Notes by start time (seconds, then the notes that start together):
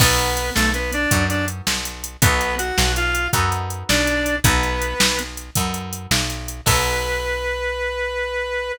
0.00 B1 B3 D#4 F#4 A4 B4, kick, crash
0.19 closed hi-hat
0.37 closed hi-hat
0.55 B1 A3 A4, snare
0.74 B3 B4, closed hi-hat
0.93 D4 D5, closed hi-hat
1.11 F#2 B3 D#4 F#4 A4, kick, closed hi-hat
1.29 D4 D5, closed hi-hat
1.48 closed hi-hat
1.67 B1, snare
1.85 closed hi-hat
2.04 closed hi-hat
2.22 B1 B3 D#4 F#4 A4 B4, kick, closed hi-hat
2.41 closed hi-hat
2.58 F#4 F#5, closed hi-hat
2.78 B1, snare
2.96 F4 F5, closed hi-hat
3.15 closed hi-hat
3.33 F#2 B3 D#4 F#4 A4, kick, closed hi-hat
3.52 closed hi-hat
3.70 closed hi-hat
3.89 B1 D4 D5, snare
4.07 closed hi-hat
4.26 closed hi-hat
4.44 B1 B3 D#4 F#4 A4 B4, kick, closed hi-hat
4.63 closed hi-hat
4.82 closed hi-hat
5.00 B1, snare
5.19 closed hi-hat
5.37 closed hi-hat
5.55 F#2 B3 D#4 F#4 A4, kick, closed hi-hat
5.74 closed hi-hat
5.93 closed hi-hat
6.11 B1, snare
6.30 closed hi-hat
6.48 closed hi-hat
6.66 B1 B3 D#4 F#4 A4 B4, kick, crash